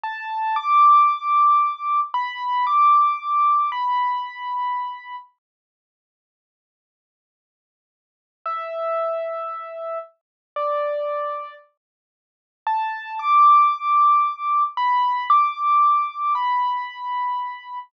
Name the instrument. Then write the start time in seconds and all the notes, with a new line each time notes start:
acoustic grand piano
0.04 A5
0.56 D6
2.14 B5
2.67 D6
3.72 B5
8.46 E5
10.56 D5
12.67 A5
13.19 D6
14.77 B5
15.30 D6
16.35 B5